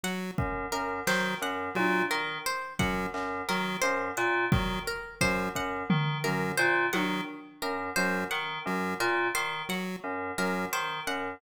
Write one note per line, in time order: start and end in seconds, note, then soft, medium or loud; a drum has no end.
0.03 0.31 F#3 medium
0.03 0.32 F#5 medium
0.38 0.66 F#2 medium
0.38 kick loud
0.72 1.00 F#2 medium
0.72 1.00 A#4 medium
1.07 1.35 D#3 medium
1.07 1.34 F#3 medium
1.07 1.35 C5 medium
1.07 snare medium
1.42 1.69 F#2 medium
1.42 1.70 F#5 medium
1.75 2.04 A#2 medium
1.75 2.02 F#3 medium
1.75 high tom medium
2.10 2.38 D#3 medium
2.10 2.38 A#4 medium
2.46 2.74 C5 medium
2.79 3.07 F#2 medium
2.79 3.06 F#3 medium
2.79 3.07 F#5 medium
2.79 kick medium
3.14 3.42 F#2 medium
3.14 clap medium
3.48 3.76 D#3 medium
3.48 3.77 F#3 medium
3.48 3.76 A#4 medium
3.81 4.10 F#2 medium
3.81 4.09 C5 medium
4.17 4.45 A#2 medium
4.17 4.45 F#5 medium
4.52 4.79 D#3 medium
4.52 4.79 F#3 medium
4.52 kick loud
4.87 5.15 A#4 medium
5.21 5.48 F#2 medium
5.21 5.49 F#3 medium
5.21 5.49 C5 medium
5.21 kick medium
5.55 5.83 F#2 medium
5.55 5.84 F#5 medium
5.55 kick medium
5.90 6.17 D#3 medium
5.90 floor tom loud
6.24 6.52 F#2 medium
6.24 6.52 F#3 medium
6.24 6.51 A#4 medium
6.24 floor tom medium
6.57 6.86 A#2 medium
6.57 6.85 C5 medium
6.93 7.21 D#3 medium
6.93 7.21 F#3 medium
6.93 7.20 F#5 medium
6.93 high tom medium
7.62 7.90 F#2 medium
7.62 7.90 A#4 medium
7.96 8.24 F#2 medium
7.96 8.24 F#3 medium
7.96 8.24 C5 medium
8.31 8.59 D#3 medium
8.31 8.58 F#5 medium
8.66 8.93 F#2 medium
8.66 8.94 F#3 medium
9.00 9.28 A#2 medium
9.00 9.28 A#4 medium
9.35 9.62 D#3 medium
9.35 9.62 C5 medium
9.69 9.96 F#3 medium
9.69 9.97 F#5 medium
10.04 10.31 F#2 medium
10.38 10.66 F#2 medium
10.38 10.66 F#3 medium
10.38 10.66 A#4 medium
10.73 11.00 D#3 medium
10.73 11.00 C5 medium
11.07 11.35 F#2 medium
11.07 11.35 F#5 medium